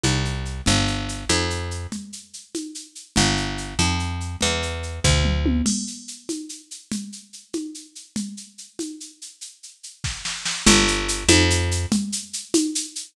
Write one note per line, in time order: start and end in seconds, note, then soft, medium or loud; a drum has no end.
0.03 0.61 C2 medium
0.03 high conga medium
0.03 shaker medium
0.25 shaker medium
0.45 shaker medium
0.66 1.25 G1 loud
0.66 low conga medium
0.66 shaker medium
0.87 shaker medium
1.09 shaker medium
1.29 1.87 F2 loud
1.29 high conga medium
1.29 shaker medium
1.50 shaker medium
1.71 shaker medium
1.92 low conga medium
1.92 shaker medium
2.13 shaker medium
2.33 shaker medium
2.55 high conga medium
2.55 shaker medium
2.75 shaker medium
2.95 shaker medium
3.16 3.74 G1 loud
3.16 low conga loud
3.16 shaker medium
3.37 shaker medium
3.58 shaker medium
3.79 4.36 F2 medium
3.79 high conga medium
3.79 shaker medium
3.99 shaker medium
4.20 shaker medium
4.41 5.00 E2 medium
4.41 low conga medium
4.41 shaker medium
4.63 shaker medium
4.83 shaker medium
5.04 5.62 D2 loud
5.04 kick medium
5.04 floor tom medium
5.25 mid tom medium
5.46 high tom loud
5.66 crash loud
5.66 low conga loud
5.66 shaker medium
5.87 shaker medium
6.08 shaker medium
6.29 high conga medium
6.29 shaker medium
6.49 shaker medium
6.71 shaker medium
6.92 low conga loud
6.92 shaker medium
7.12 shaker medium
7.33 shaker medium
7.53 high conga medium
7.53 shaker medium
7.74 shaker medium
7.95 shaker medium
8.16 low conga loud
8.16 shaker medium
8.37 shaker medium
8.58 shaker medium
8.79 high conga medium
8.79 shaker medium
9.00 shaker medium
9.22 shaker medium
9.41 shaker medium
9.63 shaker medium
9.83 shaker medium
10.04 kick medium
10.04 snare medium
10.25 snare medium
10.45 snare loud
10.66 11.24 G1 loud
10.66 low conga loud
10.66 shaker loud
10.88 shaker loud
11.08 shaker loud
11.28 11.86 F2 loud
11.28 high conga loud
11.28 shaker loud
11.50 shaker loud
11.71 shaker loud
11.92 low conga loud
11.92 shaker loud
12.12 shaker loud
12.33 shaker loud
12.54 high conga loud
12.54 shaker loud
12.75 shaker loud
12.95 shaker loud